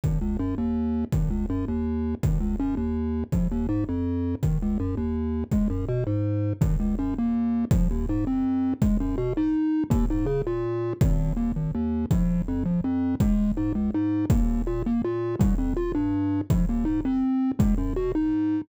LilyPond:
<<
  \new Staff \with { instrumentName = "Synth Bass 1" } { \clef bass \time 3/4 \key aes \major \tempo 4 = 164 aes,,8 des,8 ges,8 ees,4. | aes,,8 des,8 ges,8 ees,4. | aes,,8 des,8 ges,8 ees,4. | bes,,8 ees,8 aes,8 f,4. |
aes,,8 des,8 ges,8 ees,4. | des,8 ges,8 b,8 aes,4. | aes,,8 des,8 ges,8 ees,4. | bes,,8 ees,8 aes,8 f,4. |
des,8 ges,8 b,8 aes,4. | ees,8 aes,8 des8 bes,4. | aes,,4 ees,8 aes,,8 ees,4 | bes,,4 f,8 bes,,8 f,4 |
des,4 aes,8 des,8 aes,4 | ees,4 bes,8 ees,8 bes,4 | c,8 f,8 bes,8 g,4. | bes,,8 ees,8 aes,8 f,4. |
des,8 ges,8 b,8 aes,4. | }
  \new DrumStaff \with { instrumentName = "Drums" } \drummode { \time 3/4 bd4 r4 r4 | bd4 r4 r4 | bd4 r4 r4 | bd4 r4 r4 |
bd4 r4 r4 | bd4 r4 r4 | bd4 r4 r4 | bd4 r4 r4 |
bd4 r4 r4 | bd4 r4 r4 | bd4 r4 r4 | bd4 r4 r4 |
bd4 r4 r4 | bd4 r4 r4 | bd4 r4 r4 | bd4 r4 r4 |
bd4 r4 r4 | }
>>